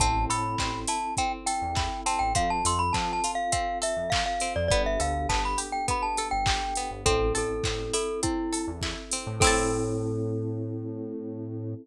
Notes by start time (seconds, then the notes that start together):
0.00 A1 C4 E4 A4 A5, kick, closed hi-hat
0.29 A2 A4 B5, open hi-hat
0.58 A1 C4, kick, clap
0.87 E4 A5, open hi-hat
1.17 C4 G5, kick, closed hi-hat
1.46 A4 G5, open hi-hat
1.62 E2
1.75 E4, kick, clap
2.06 C4 A5, open hi-hat
2.19 A1 G5
2.35 F2 C4 F4 A4 F5, kick, closed hi-hat
2.50 A5
2.65 F2 A4 C6, open hi-hat
2.79 B5
2.93 F3 C4 A5, kick, clap
3.13 A5
3.24 F4, open hi-hat
3.35 F5
3.52 C4 F5, kick, closed hi-hat
3.82 A4 E5, open hi-hat
3.97 F2
4.10 F4 F5, kick, clap
4.26 F5
4.40 C4, open hi-hat
4.56 F2 D5
4.68 G1 B3 D4 G4 A4 D5, kick, closed hi-hat
4.86 E5
5.00 D2 A4 F5, open hi-hat
5.29 G1 B3 A5, kick, clap
5.45 B5
5.58 G4, open hi-hat
5.72 G5
5.88 B3 B5, kick, closed hi-hat
6.03 A5
6.17 A4, open hi-hat
6.31 G1 G5
6.46 G4, kick, clap
6.75 B3, open hi-hat
6.91 G1
7.06 A1 C4 E4 A4, kick, closed hi-hat
7.35 A1 A4, open hi-hat
7.64 A1 C4, kick, clap
7.93 E4 A4, open hi-hat
8.22 C4 E4, kick, closed hi-hat
8.52 A4, open hi-hat
8.68 E2
8.81 E4, kick, clap
9.12 C4, open hi-hat
9.27 A2
9.40 A2 C4 E4 A4, kick, crash
9.47 A4